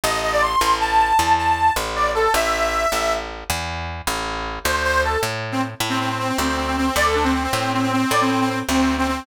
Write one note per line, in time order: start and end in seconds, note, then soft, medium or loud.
0.04 0.56 A1 medium
0.04 0.21 D#5 medium
0.23 0.32 D#5 medium
0.32 0.42 D5 medium
0.42 0.77 C6 medium
0.61 1.13 A1 medium
0.80 1.32 A5 medium
1.19 1.71 E2 medium
1.38 1.73 A5 medium
1.76 2.28 A1 medium
1.96 2.12 D5 medium
2.15 2.33 A4 medium
2.34 2.86 A1 medium
2.34 3.13 E5 medium
2.92 3.44 A1 medium
3.50 4.02 E2 medium
4.07 4.59 A1 medium
4.64 5.17 D2 medium
4.64 4.83 C5 medium
4.84 5.02 C5 medium
5.04 5.20 A4 medium
5.23 5.75 A2 medium
5.52 5.61 C4 medium
5.80 6.32 A2 medium
5.89 5.98 C4 medium
6.00 6.09 C4 medium
6.09 6.18 C4 medium
6.19 6.28 C4 medium
6.29 6.37 C4 medium
6.38 6.90 D2 medium
6.38 6.47 C4 medium
6.48 6.57 C4 medium
6.57 6.66 C4 medium
6.67 6.76 C4 medium
6.77 6.86 C4 medium
6.87 6.96 C4 medium
6.96 7.48 D2 medium
6.96 7.05 D5 medium
7.06 7.15 A4 medium
7.15 7.24 D4 medium
7.24 7.33 C4 medium
7.34 7.43 C4 medium
7.44 7.71 C4 medium
7.53 8.05 A2 medium
7.73 7.82 C4 medium
7.82 7.92 C4 medium
7.92 8.11 C4 medium
8.11 8.63 A2 medium
8.11 8.21 D5 medium
8.21 8.30 C4 medium
8.31 8.40 C4 medium
8.41 8.49 C4 medium
8.50 8.59 C4 medium
8.69 9.21 D2 medium
8.69 8.95 C4 medium
8.98 9.07 C4 medium
9.08 9.25 C4 medium